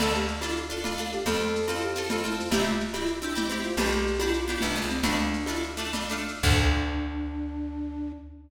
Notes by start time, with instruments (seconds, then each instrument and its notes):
0.00 electric bass (finger) D2, pizzicato strings D4 F4 A4, flute A4, crash, cowbell, low conga, shaker
0.14 flute G4, shaker
0.28 shaker
0.41 pizzicato strings D4 F4 A4, cowbell, high conga, shaker
0.56 shaker
0.70 pizzicato strings D4 F4 A4, flute F4, shaker
0.84 pizzicato strings D4 F4 A4, flute F4, cowbell, low conga, shaker
0.96 pizzicato strings D4 F4, shaker
1.00 pizzicato strings A4
1.12 flute G4, shaker
1.26 electric bass (finger) F2, pizzicato strings C4 F4 A4, flute A4, cowbell, low conga, shaker
1.40 shaker
1.55 shaker
1.67 pizzicato strings C4 F4 A4, cowbell, high conga, shaker
1.80 flute G4, shaker
1.95 pizzicato strings C4 F4 A4, shaker
2.09 pizzicato strings C4 F4 A4, flute F4, cowbell, low conga, shaker
2.24 pizzicato strings C4 F4 A4, flute E4, shaker
2.37 flute F4, shaker
2.51 electric bass (finger) C2, pizzicato strings C4 E4 G4, flute G4, cowbell, low conga, shaker
2.64 flute F4, shaker
2.80 shaker
2.93 pizzicato strings C4 E4 G4, cowbell, high conga, shaker
3.06 shaker
3.21 pizzicato strings C4 E4 G4, flute D4, shaker
3.35 pizzicato strings C4 E4 G4, flute E4, cowbell, low conga, shaker
3.49 pizzicato strings C4 E4 G4, shaker
3.63 flute F4, shaker
3.77 electric bass (finger) B1, pizzicato strings B3 D4 G4, flute G4, cowbell, low conga, shaker
3.91 shaker
4.07 shaker
4.19 pizzicato strings B3 D4 G4, cowbell, high conga, shaker
4.33 flute F4, shaker
4.48 pizzicato strings B3 D4 G4, shaker
4.61 electric bass (finger) C2, pizzicato strings B3 D4 G4, flute D4, cowbell, low conga, shaker
4.76 pizzicato strings B3 D4 G4, flute F4, shaker
4.82 electric bass (finger) C#2
4.89 flute C4, shaker
5.02 electric bass (finger) D2, pizzicato strings A3 D4 F4, flute D4, cowbell, low conga, shaker
5.19 shaker
5.33 shaker
5.46 pizzicato strings A3 D4 F4, cowbell, high conga, shaker
5.62 shaker
5.77 pizzicato strings A3 D4 F4, shaker
5.93 pizzicato strings A3 D4 F4, cowbell, low conga, shaker
6.08 pizzicato strings A3 D4 F4, shaker
6.28 shaker
6.43 electric bass (finger) D2, flute D4, pizzicato strings D4 F4 A4, kick, crash